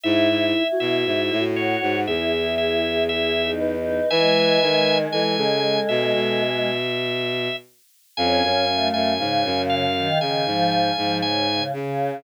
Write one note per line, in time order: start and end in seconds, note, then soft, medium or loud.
0.04 0.28 G#2 medium
0.04 0.45 E4 loud
0.04 0.63 E4 loud
0.04 0.67 E5 medium
0.29 0.53 G#2 medium
0.55 1.41 E4 loud
0.72 1.33 F#4 medium
0.80 1.04 B2 medium
0.80 1.44 E5 medium
1.06 1.30 G#2 medium
1.31 1.76 A2 medium
1.39 1.96 F#4 medium
1.56 2.02 F#4 loud
1.56 2.00 C#5 medium
1.82 2.06 G#2 medium
2.07 4.00 E2 medium
2.07 2.31 E4 medium
2.07 3.54 G#4 medium
2.07 2.55 E5 medium
2.33 3.04 E4 loud
2.58 3.04 E5 medium
3.09 3.41 E4 loud
3.09 3.51 E5 medium
3.43 3.75 D#4 loud
3.60 4.09 B4 medium
3.76 4.09 D#4 loud
4.10 4.58 E3 medium
4.10 6.69 G#3 loud
4.10 4.98 B4 loud
4.10 4.98 E5 medium
4.10 4.98 G#5 medium
4.62 5.07 D#3 medium
5.12 5.36 E3 medium
5.12 5.37 A4 medium
5.12 5.80 G#5 medium
5.37 5.78 C#3 medium
5.37 6.42 A4 medium
5.89 6.13 B2 medium
5.89 6.13 E5 medium
6.14 7.49 B2 medium
6.14 7.56 E5 medium
8.17 8.42 F2 medium
8.17 8.65 C#4 loud
8.17 9.14 F5 loud
8.17 8.88 G#5 medium
8.43 8.90 F#2 medium
8.69 9.12 A3 loud
8.94 9.18 F#2 medium
8.94 9.62 G#5 medium
9.18 9.43 G#2 medium
9.18 9.85 C#3 loud
9.18 11.15 F5 medium
9.45 10.08 F#2 medium
9.70 10.19 F5 medium
9.96 10.20 D#3 loud
10.21 10.45 C#3 medium
10.21 10.45 D#3 medium
10.21 10.70 G#5 medium
10.46 10.91 G#2 medium
10.46 10.93 F3 loud
10.71 11.18 G#5 medium
10.97 11.61 G#2 medium
10.97 11.21 F3 loud
11.22 11.47 C#3 loud
11.22 11.64 G#5 medium
11.47 11.72 C#3 loud
11.73 12.17 C#3 loud
11.73 12.20 C#3 medium